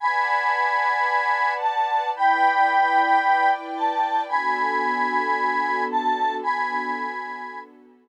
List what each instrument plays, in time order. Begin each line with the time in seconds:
0.00 string ensemble 1 B4 D5 F#5 A5, lead 1 (square) G#5 B5
1.61 lead 1 (square) A5
2.14 string ensemble 1 E4 B4 D5 G5, lead 1 (square) G5 B5
3.76 lead 1 (square) A5
4.28 string ensemble 1 B3 D4 F#4 A4, lead 1 (square) G#5 B5
5.91 lead 1 (square) A5
6.43 string ensemble 1 B3 D4 F#4 A4, lead 1 (square) G#5 B5